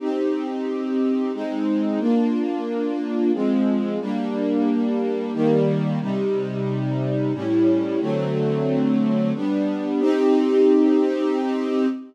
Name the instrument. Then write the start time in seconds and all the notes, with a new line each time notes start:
string ensemble 1
0.00 C4 D#4 G4
1.33 G#3 C4 D#4
1.99 A#3 D4 F4
3.33 F3 G#3 C4
4.00 G3 A#3 D4
5.33 D#3 G3 A#3
6.00 C3 G3 D#4
7.33 A2 G3 C#4 E4
8.00 D3 F#3 A3 C4
9.35 G3 B3 D4
10.00 C4 D#4 G4